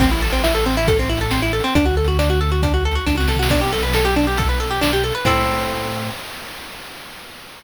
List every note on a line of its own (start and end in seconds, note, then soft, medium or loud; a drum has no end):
0.00 1.61 A1 loud
0.00 0.10 C4 loud
0.00 kick loud
0.00 crash loud
0.11 0.21 E4 medium
0.22 0.32 A4 medium
0.30 0.42 C4 medium
0.30 closed hi-hat medium
0.44 0.54 E4 medium
0.44 snare loud
0.55 0.65 A4 medium
0.66 0.76 C4 medium
0.73 closed hi-hat medium
0.77 0.87 E4 loud
0.87 0.98 A4 medium
0.87 kick loud
0.87 closed hi-hat loud
0.99 1.09 C4 medium
1.09 1.19 E4 medium
1.17 1.31 A4 medium
1.17 closed hi-hat medium
1.31 1.41 C4 medium
1.31 snare loud
1.42 1.52 E4 medium
1.53 1.63 A4 medium
1.60 closed hi-hat medium
1.64 1.74 C4 medium
1.75 3.00 D2 loud
1.75 1.85 D4 loud
1.75 kick loud
1.75 closed hi-hat loud
1.86 1.95 F#4 medium
1.97 2.07 A4 medium
2.04 2.18 F#4 medium
2.04 closed hi-hat medium
2.19 2.29 D4 loud
2.19 snare loud
2.30 2.40 F#4 medium
2.41 2.51 A4 medium
2.49 2.61 F#4 medium
2.49 closed hi-hat medium
2.63 2.73 D4 medium
2.63 kick loud
2.63 closed hi-hat loud
2.74 2.84 F#4 medium
2.85 2.95 A4 medium
2.91 closed hi-hat medium
2.95 3.05 F#4 medium
3.06 3.27 C#2 medium
3.06 3.16 D4 medium
3.06 kick medium
3.06 snare medium
3.15 3.27 F#4 medium
3.15 high tom medium
3.20 snare medium
3.28 3.48 C2 medium
3.28 3.38 A4 medium
3.28 snare loud
3.35 3.49 F#4 medium
3.35 floor tom loud
3.43 snare loud
3.49 5.12 B1 loud
3.49 3.61 D4 loud
3.49 kick loud
3.49 crash loud
3.61 3.71 G4 medium
3.73 3.83 A4 medium
3.80 3.93 B4 medium
3.80 closed hi-hat medium
3.93 4.05 A4 medium
3.93 snare loud
4.05 4.15 G4 medium
4.16 4.26 D4 medium
4.23 closed hi-hat medium
4.27 4.37 G4 medium
4.37 4.48 A4 medium
4.37 kick loud
4.37 closed hi-hat loud
4.49 4.59 B4 medium
4.60 4.70 A4 medium
4.67 4.80 G4 medium
4.67 closed hi-hat medium
4.81 4.91 D4 medium
4.81 snare loud
4.93 5.03 G4 medium
5.04 5.14 A4 medium
5.11 5.25 B4 medium
5.11 closed hi-hat medium
5.25 6.10 A2 loud
5.25 6.10 C4 loud
5.25 6.10 E4 medium
5.25 6.10 A4 medium
5.25 kick loud
5.25 crash loud